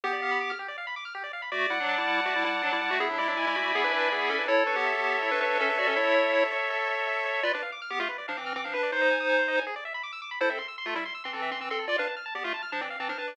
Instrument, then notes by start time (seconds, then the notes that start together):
lead 1 (square)
0.04 B3 G4
0.13 D5
0.22 F5
0.31 B5
0.41 D6
0.50 F6
0.59 G4
0.68 D5
0.78 F5
0.87 B5
0.96 D6
1.05 F6
1.15 G4
1.23 D5
1.33 F5
1.42 B5
1.52 A3 F#4 D5
1.70 G3 E4 F#5
1.80 F#3 D4
1.89 A5
1.98 G3 E4
2.08 F#5
2.26 A3 F#4 D5
2.36 G3 E4
2.44 G3 E4 F#5
2.62 F#3 D4 A5
2.73 G3 E4
2.81 G3 E4 F#5
2.91 A3 F#4
3.00 B3 E4 G#4
3.09 F#3 D4
3.18 G#3 E4 D5
3.28 F#3 D4
3.37 G#3 E4 G#5
3.47 G#3 E4
3.55 A3 F#4 B5
3.74 B3 G#4 G#5
3.84 D4 B4
3.92 D4 B4 D5
4.11 B3 E4 G#4
4.29 C#4 A4 D5
4.39 D4 B4
4.48 E4 A4 C#5
4.66 D4 B4 C#5
4.76 B3 G4
4.85 E5
4.94 B3 G4
5.03 C#5
5.22 E4 A4 C#5
5.31 D4 B4
5.40 D4 B4 C#5
5.59 C#4 A4 E5
5.69 D4 B4
5.77 F#4 C#5 D5
5.87 C#4 A4
5.96 E4 A4 C#5
6.15 C#5
6.33 E5
6.52 C#5
6.70 A4
6.89 C#5
7.07 E5
7.25 C#5
7.43 F4 B4 D5
7.53 D4 B4 D5
7.63 F5
7.72 D6
7.82 F6
7.90 B3 G4 D6
8.00 A3 F4 F5
8.09 B4
8.18 D5
8.28 F3 D4 F5
8.37 E3 C4 D6
8.46 F6
8.56 E3 C4 D6
8.64 F3 D4 F5
8.74 D4 B4
8.83 D5
8.92 D#4 C5
9.01 D#5
9.11 G#5
9.20 D#6
9.29 G#5
9.39 C5
9.48 D#5
9.57 G#5
9.67 G#4
9.76 D5
9.85 E5
9.94 B5
10.03 D6
10.13 E6
10.22 D6
10.31 B5
10.41 E4 A4 C5
10.50 C4 A4 E5
10.59 C6
10.68 E6
10.78 C6
10.86 A3 F4 A4
10.95 G3 E4 E5
11.05 C6
11.15 E6
11.24 E3 C4 C6
11.33 E3 C4 A4
11.42 E5
11.51 E3 C4 C6
11.60 E3 C4 E6
11.70 C4 A4 C6
11.79 A4
11.88 F4 D5
11.98 D4 B4 F5
12.07 A5
12.17 F6
12.26 A5
12.35 B3 G4 D5
12.44 A3 F4 F5
12.54 A5
12.62 F6
12.72 F3 D4 A5
12.81 E3 C4 D5
12.90 F5
13.00 E3 C4 A5
13.09 F3 D4 F6
13.18 D4 B4 A5
13.28 D5